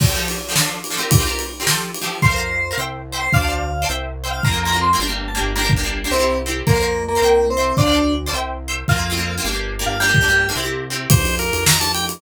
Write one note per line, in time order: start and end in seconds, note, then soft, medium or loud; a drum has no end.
0.00 0.06 F3 medium
0.00 0.06 C4 medium
0.00 0.06 G4 medium
0.00 0.06 A4 medium
0.00 kick medium
0.00 crash medium
0.07 0.13 F3 medium
0.07 0.13 C4 medium
0.07 0.13 G4 medium
0.07 0.13 A4 medium
0.14 0.36 F3 medium
0.14 0.36 C4 medium
0.14 0.36 G4 medium
0.14 0.36 A4 medium
0.28 ride medium
0.49 0.54 F3 medium
0.49 0.54 C4 medium
0.49 0.54 G4 medium
0.49 0.55 A4 medium
0.55 0.78 F3 medium
0.55 0.78 D4 medium
0.55 0.78 A4 medium
0.55 snare medium
0.84 ride medium
0.90 0.97 F3 medium
0.90 0.97 D4 medium
0.90 0.97 A4 medium
0.97 1.17 C4 medium
0.97 1.17 F4 medium
0.97 1.17 G4 medium
0.97 1.17 A#4 medium
1.11 kick medium
1.11 ride medium
1.18 1.24 C4 medium
1.18 1.24 F4 medium
1.18 1.24 G4 medium
1.18 1.24 A#4 medium
1.25 1.47 C4 medium
1.25 1.47 F4 medium
1.25 1.47 G4 medium
1.25 1.47 A#4 medium
1.39 ride medium
1.60 1.65 C4 medium
1.60 1.65 F4 medium
1.60 1.65 G4 medium
1.60 1.66 A#4 medium
1.67 1.89 F3 medium
1.67 1.89 G4 medium
1.67 1.89 A4 medium
1.67 1.89 C5 medium
1.67 snare medium
1.94 ride medium
2.01 2.18 F3 medium
2.01 2.18 G4 medium
2.01 2.18 A4 medium
2.01 2.18 C5 medium
2.22 2.73 F2 medium
2.22 2.28 A#4 medium
2.22 2.70 C5 medium
2.22 2.28 C5 medium
2.22 2.28 F5 medium
2.22 kick medium
2.29 2.35 A#4 medium
2.29 2.35 C5 medium
2.29 2.35 F5 medium
2.36 2.58 A#4 medium
2.36 2.58 C5 medium
2.36 2.58 F5 medium
2.71 2.76 A#4 medium
2.71 2.76 C5 medium
2.71 2.76 F5 medium
2.77 3.28 C2 medium
2.77 3.00 C5 medium
2.77 3.00 E5 medium
2.77 3.00 G5 medium
3.12 3.29 C5 medium
3.12 3.29 E5 medium
3.12 3.29 G5 medium
3.19 3.31 C5 medium
3.33 3.85 D2 medium
3.33 3.39 C5 medium
3.33 3.39 D5 medium
3.33 3.82 F5 medium
3.33 3.39 F5 medium
3.33 3.39 A5 medium
3.33 kick medium
3.40 3.46 C5 medium
3.40 3.46 D5 medium
3.40 3.46 F5 medium
3.40 3.46 A5 medium
3.47 3.70 C5 medium
3.47 3.70 D5 medium
3.47 3.70 F5 medium
3.47 3.70 A5 medium
3.82 3.88 C5 medium
3.82 3.88 D5 medium
3.82 3.88 F5 medium
3.82 3.88 A5 medium
3.89 4.41 C2 medium
3.89 4.11 C5 medium
3.89 4.11 E5 medium
3.89 4.11 G5 medium
4.24 4.40 C5 medium
4.24 4.40 E5 medium
4.24 4.40 G5 medium
4.31 4.43 F5 medium
4.43 4.95 F2 medium
4.43 4.50 A#3 medium
4.43 4.50 C4 medium
4.43 4.50 F4 medium
4.43 4.60 A#5 medium
4.43 kick medium
4.51 4.63 A#3 medium
4.51 4.63 C4 medium
4.51 4.63 F4 medium
4.63 4.71 A#3 medium
4.63 4.71 C4 medium
4.63 4.79 A#5 medium
4.67 4.71 F4 medium
4.72 4.89 A#3 medium
4.72 4.89 C4 medium
4.72 4.89 F4 medium
4.81 4.99 C6 medium
4.93 4.99 A#3 medium
4.93 4.99 C4 medium
4.93 4.99 F4 medium
4.99 5.39 G1 medium
4.99 5.06 A#3 medium
4.99 5.06 D4 medium
4.99 5.06 G4 medium
5.07 5.29 A#3 medium
5.07 5.29 D4 medium
5.07 5.29 G4 medium
5.28 5.41 A5 medium
5.35 5.51 A#3 medium
5.35 5.51 D4 medium
5.35 5.51 G4 medium
5.41 6.06 G1 medium
5.56 5.61 A#3 medium
5.56 5.61 D4 medium
5.56 5.61 G4 medium
5.56 5.69 A#4 medium
5.63 5.74 A#3 medium
5.63 5.74 D4 medium
5.63 5.74 G4 medium
5.70 kick medium
5.76 5.82 A#3 medium
5.76 5.82 D4 medium
5.76 5.82 G4 medium
5.83 6.00 A#3 medium
5.83 6.00 D4 medium
5.83 6.00 G4 medium
6.04 6.10 A#3 medium
6.04 6.10 D4 medium
6.04 6.10 G4 medium
6.11 6.62 C2 medium
6.11 6.17 C4 medium
6.11 6.36 C4 medium
6.11 6.17 E4 medium
6.11 6.17 G4 medium
6.18 6.40 C4 medium
6.18 6.40 E4 medium
6.18 6.40 G4 medium
6.46 6.63 C4 medium
6.46 6.63 E4 medium
6.46 6.63 G4 medium
6.67 7.18 F2 medium
6.67 7.02 A#3 medium
6.67 6.72 A#4 medium
6.67 6.72 C5 medium
6.67 6.72 F5 medium
6.67 kick medium
6.74 6.79 A#4 medium
6.74 6.79 C5 medium
6.74 6.79 F5 medium
6.81 7.03 A#4 medium
6.81 7.03 C5 medium
6.81 7.03 F5 medium
7.08 7.46 A#3 medium
7.15 7.21 A#4 medium
7.15 7.21 C5 medium
7.15 7.21 F5 medium
7.22 7.73 C2 medium
7.22 7.44 C5 medium
7.22 7.44 E5 medium
7.22 7.44 G5 medium
7.50 7.75 C4 medium
7.57 7.74 C5 medium
7.57 7.74 E5 medium
7.57 7.74 G5 medium
7.77 8.29 D2 medium
7.77 8.13 D4 medium
7.77 7.83 C5 medium
7.77 7.83 D5 medium
7.77 7.83 F5 medium
7.77 7.84 A5 medium
7.77 kick medium
7.85 7.90 C5 medium
7.85 7.90 D5 medium
7.85 7.90 F5 medium
7.85 7.91 A5 medium
7.92 8.14 C5 medium
7.92 8.14 D5 medium
7.92 8.14 F5 medium
7.92 8.14 A5 medium
8.26 8.32 C5 medium
8.26 8.32 D5 medium
8.26 8.32 F5 medium
8.26 8.32 A5 medium
8.33 8.84 C2 medium
8.33 8.55 C5 medium
8.33 8.55 E5 medium
8.33 8.55 G5 medium
8.68 8.85 C5 medium
8.68 8.85 E5 medium
8.68 8.85 G5 medium
8.88 9.39 F2 medium
8.88 8.94 A#3 medium
8.88 8.94 C4 medium
8.88 9.34 F4 medium
8.88 8.94 F4 medium
8.88 kick medium
8.96 9.07 A#3 medium
8.96 9.07 C4 medium
8.96 9.07 F4 medium
9.10 9.15 A#3 medium
9.10 9.15 C4 medium
9.10 9.15 F4 medium
9.17 9.33 A#3 medium
9.17 9.33 C4 medium
9.17 9.33 F4 medium
9.38 9.43 A#3 medium
9.38 9.43 C4 medium
9.38 9.43 F4 medium
9.44 9.84 G1 medium
9.44 9.50 A#3 medium
9.44 9.50 D4 medium
9.44 9.50 G4 medium
9.51 9.74 A#3 medium
9.51 9.74 D4 medium
9.51 9.74 G4 medium
9.79 9.96 A#3 medium
9.79 9.96 D4 medium
9.79 9.96 G4 medium
9.86 10.51 G1 medium
9.86 9.99 F4 medium
10.00 10.06 A#3 medium
10.00 10.06 D4 medium
10.00 10.48 G4 medium
10.00 10.06 G4 medium
10.07 10.18 A#3 medium
10.07 10.18 D4 medium
10.07 10.18 G4 medium
10.14 kick medium
10.21 10.26 A#3 medium
10.21 10.26 D4 medium
10.21 10.26 G4 medium
10.28 10.44 A#3 medium
10.28 10.44 D4 medium
10.28 10.44 G4 medium
10.49 10.54 A#3 medium
10.49 10.54 D4 medium
10.49 10.54 G4 medium
10.55 11.07 C2 medium
10.55 10.61 C4 medium
10.55 10.61 E4 medium
10.55 10.61 G4 medium
10.63 10.85 C4 medium
10.63 10.85 E4 medium
10.63 10.85 G4 medium
10.90 11.07 C4 medium
10.90 11.07 E4 medium
10.90 11.07 G4 medium
11.10 11.51 F2 medium
11.10 11.35 C5 loud
11.10 kick loud
11.10 ride loud
11.25 ride medium
11.39 11.64 A#4 loud
11.39 ride medium
11.53 12.18 F2 medium
11.53 ride medium
11.66 11.78 A#5 loud
11.66 snare loud
11.80 11.92 A5 loud
11.80 ride medium
11.94 12.05 G5 loud
11.94 ride medium
12.09 ride medium